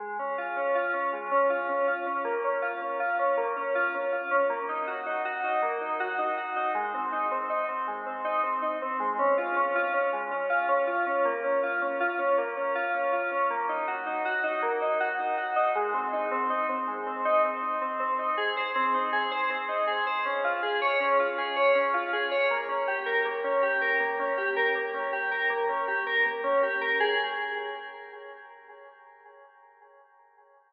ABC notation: X:1
M:3/4
L:1/16
Q:1/4=80
K:Db
V:1 name="Electric Piano 2"
A, D F D F D A, D F D F D | B, D F D F D B, D F D F D | B, E G E G E B, E G E G E | A, C E C E C A, C E C E C |
A, D F D F D A, D F D F D | B, D F D F D B, D F D F D | B, E G E G E B, E G E G E | A, C E C E C A, C E C E C |
[K:Ab] C E A c C E A c C E A c | D F A d D F A d D F A d | B, D G B B, D G B B, D G B | B, D G B B, D G B B, D G B |
A4 z8 |]